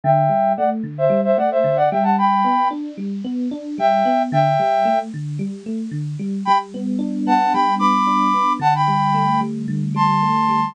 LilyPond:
<<
  \new Staff \with { instrumentName = "Flute" } { \time 4/4 \key g \major \tempo 4 = 112 <e'' g''>4 <d'' fis''>16 r8 <c'' e''>8 <c'' e''>16 <d'' fis''>16 <c'' e''>8 <d'' fis''>16 <e'' g''>16 <fis'' a''>16 | <g'' b''>4 r2 <e'' g''>4 | <e'' g''>4. r2 r8 | <g'' b''>16 r4 r16 <fis'' a''>8 <g'' b''>8 <b'' d'''>4. |
<fis'' a''>16 <g'' b''>4~ <g'' b''>16 r4 <a'' c'''>4. | }
  \new Staff \with { instrumentName = "Electric Piano 1" } { \time 4/4 \key g \major d8 g8 a8 d8 g8 a8 d8 g8~ | g8 b8 d'8 g8 b8 d'8 g8 b8 | d8 g8 a8 d8 g8 a8 d8 g8 | g8 b8 d'8 b8 g8 b8 d'8 b8 |
d8 g8 a8 g8 d8 g8 a8 g8 | }
>>